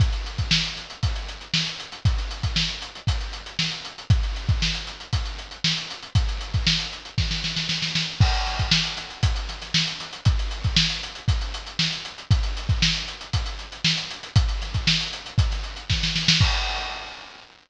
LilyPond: \new DrumStaff \drummode { \time 4/4 \tempo 4 = 117 <hh bd>16 hh16 hh16 <hh bd>16 sn16 hh16 <hh sn>16 hh16 <hh bd>16 hh16 hh16 hh16 sn16 hh16 hh16 hh16 | <hh bd>16 hh16 hh16 <hh bd>16 sn16 <hh sn>16 hh16 hh16 <hh bd>16 hh16 hh16 hh16 sn16 hh16 hh16 hh16 | <hh bd>16 hh16 hh16 <hh bd>16 sn16 <hh sn>16 <hh sn>16 hh16 <hh bd>16 hh16 hh16 hh16 sn16 hh16 hh16 hh16 | <hh bd>16 hh16 hh16 <hh bd>16 sn16 hh16 hh16 hh16 <bd sn>16 sn16 sn16 sn16 sn16 sn16 sn8 |
<cymc bd>16 hh16 <hh sn>16 <hh bd sn>16 sn16 hh16 <hh sn>16 hh16 <hh bd>16 hh16 <hh sn>16 <hh sn>16 sn16 hh16 <hh sn>16 hh16 | <hh bd>16 hh16 hh16 <hh bd>16 sn16 hh16 hh16 hh16 <hh bd>16 hh16 hh16 hh16 sn16 hh16 hh16 hh16 | <hh bd>16 hh16 hh16 <hh bd>16 sn16 hh16 hh16 hh16 <hh bd>16 hh16 hh16 hh16 sn16 hh16 hh16 hh16 | <hh bd>16 hh16 <hh sn>16 <hh bd>16 sn16 hh16 hh16 hh16 <hh bd>16 <hh sn>16 hh16 hh16 <bd sn>16 sn16 sn16 sn16 |
<cymc bd>4 r4 r4 r4 | }